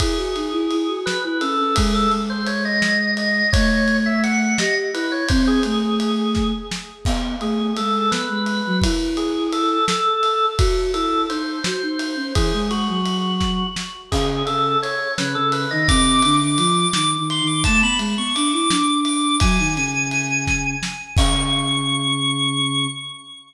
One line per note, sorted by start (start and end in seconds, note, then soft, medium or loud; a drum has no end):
0.00 0.16 E4 medium
0.00 0.96 G#4 medium
0.00 kick medium
0.00 ride medium
0.18 0.34 F#4 medium
0.35 0.52 D#4 medium
0.35 ride medium
0.52 0.69 E4 loud
0.71 0.88 E4 medium
0.71 ride medium
0.88 1.17 F#4 medium
1.06 1.22 B4 loud
1.06 snare medium
1.24 1.41 E4 medium
1.24 1.41 B4 medium
1.41 1.58 C#4 medium
1.41 1.58 A4 medium
1.41 ride medium
1.58 1.75 C#4 medium
1.58 1.75 A4 loud
1.76 2.07 G#3 loud
1.76 1.93 G#4 medium
1.76 kick medium
1.76 ride loud
1.94 2.11 A4 loud
2.12 3.42 G#3 medium
2.12 ride medium
2.30 2.46 C5 medium
2.46 2.64 C#5 medium
2.46 ride medium
2.65 3.11 D#5 medium
2.82 snare medium
3.17 3.50 D#5 medium
3.17 ride medium
3.52 4.55 A3 loud
3.52 3.97 C#5 loud
3.52 kick loud
3.52 ride medium
3.88 ride medium
4.06 4.23 E5 medium
4.24 4.58 F#5 loud
4.24 ride medium
4.58 4.90 G4 medium
4.58 4.75 D#5 medium
4.58 snare loud
4.94 5.24 E4 medium
4.94 5.11 B4 medium
4.94 ride medium
5.12 5.29 C#5 medium
5.29 5.60 C4 loud
5.29 5.45 C5 loud
5.29 kick medium
5.29 ride medium
5.47 6.48 G#4 loud
5.63 6.52 A3 medium
5.63 ride medium
6.00 ride medium
6.35 kick medium
6.35 snare medium
6.71 snare medium
7.05 7.36 B3 loud
7.05 kick medium
7.05 crash loud
7.40 7.72 A3 medium
7.40 7.74 G#4 medium
7.40 ride medium
7.77 8.09 G#3 medium
7.77 8.10 A4 medium
7.77 ride medium
8.11 8.28 B3 medium
8.11 8.77 B4 loud
8.11 snare medium
8.29 8.61 G#3 medium
8.46 ride medium
8.66 8.83 F#3 loud
8.82 9.77 E4 medium
8.82 kick medium
8.82 ride loud
9.17 9.49 G#4 medium
9.17 ride medium
9.52 9.85 A4 medium
9.52 ride medium
9.88 10.46 A4 loud
9.88 snare loud
10.23 ride medium
10.58 10.91 F#4 loud
10.58 kick loud
10.58 ride medium
10.93 11.25 E4 medium
10.93 11.22 A4 medium
10.93 ride medium
11.29 11.59 D#4 medium
11.29 11.63 C5 medium
11.29 ride medium
11.64 11.82 F#4 medium
11.64 12.32 C5 loud
11.64 snare loud
11.82 12.15 D#4 medium
11.99 ride medium
12.16 12.33 C#4 medium
12.35 12.52 E3 medium
12.35 12.69 G#4 loud
12.35 kick medium
12.35 ride medium
12.53 12.70 G#3 medium
12.71 12.87 G#3 medium
12.71 13.67 F#4 medium
12.71 ride medium
12.88 13.63 F#3 medium
13.06 ride medium
13.40 kick medium
13.40 snare medium
13.76 snare medium
14.11 14.42 C#3 medium
14.11 14.46 G#4 loud
14.11 kick medium
14.11 crash loud
14.46 14.76 C#3 medium
14.46 14.78 A4 loud
14.46 ride medium
14.82 15.12 C#5 medium
14.82 ride medium
15.18 15.35 C#3 medium
15.18 15.35 B4 medium
15.18 snare loud
15.35 15.66 C#3 medium
15.35 15.52 A4 loud
15.52 15.70 B4 medium
15.52 ride medium
15.71 15.88 D#3 medium
15.71 15.87 D#5 medium
15.88 16.21 C3 loud
15.88 16.36 D6 loud
15.88 kick medium
15.88 ride medium
16.22 16.40 D3 medium
16.22 ride medium
16.40 16.57 D3 medium
16.40 16.58 D6 medium
16.57 16.86 F3 medium
16.57 16.88 D6 loud
16.57 ride medium
16.93 17.17 D#3 medium
16.93 17.11 D6 loud
16.93 snare loud
17.18 17.41 D#3 medium
17.30 17.47 C6 medium
17.30 ride medium
17.41 17.64 D#3 loud
17.47 17.64 D6 medium
17.64 17.83 A3 medium
17.64 17.81 A5 loud
17.64 kick medium
17.64 ride medium
17.82 17.99 B3 medium
17.82 18.00 B5 loud
17.98 18.15 G#3 loud
17.98 ride medium
18.18 18.34 B3 medium
18.18 18.35 C#6 medium
18.35 18.52 D4 medium
18.35 18.52 D6 loud
18.35 ride medium
18.53 18.70 E4 medium
18.53 18.98 D6 medium
18.69 19.36 D4 medium
18.69 snare loud
19.05 19.36 D6 medium
19.05 ride medium
19.40 19.58 F#3 loud
19.40 20.67 G#5 loud
19.40 kick loud
19.40 ride medium
19.59 19.76 D#3 medium
19.76 20.75 C#3 medium
19.76 ride medium
20.11 ride medium
20.47 kick medium
20.47 snare medium
20.83 snare medium
21.17 22.87 C#3 loud
21.17 22.87 C#6 loud
21.17 kick loud
21.17 crash loud